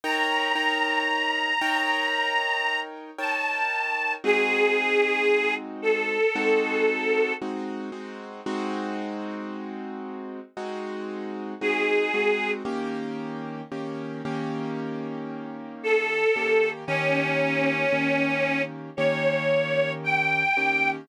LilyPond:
<<
  \new Staff \with { instrumentName = "Harmonica" } { \time 4/4 \key ees \major \tempo 4 = 57 bes''2. a''4 | aes'4. a'4. r4 | r2. aes'4 | r2. a'4 |
des'2 des''4 g''4 | }
  \new Staff \with { instrumentName = "Acoustic Grand Piano" } { \time 4/4 \key ees \major <ees' bes' des'' g''>8 <ees' bes' des'' g''>4 <ees' bes' des'' g''>4. <ees' bes' des'' g''>4 | <aes c' ees' ges'>2 <aes c' ees' ges'>4 <aes c' ees' ges'>8 <aes c' ees' ges'>8 | <aes c' ees' ges'>2 <aes c' ees' ges'>4 <aes c' ees' ges'>8 <aes c' ees' ges'>8 | <ees bes des' g'>4 <ees bes des' g'>8 <ees bes des' g'>2 <ees bes des' g'>8 |
<ees bes des' g'>4 <ees bes des' g'>4 <ees bes des' g'>4. <ees bes des' g'>8 | }
>>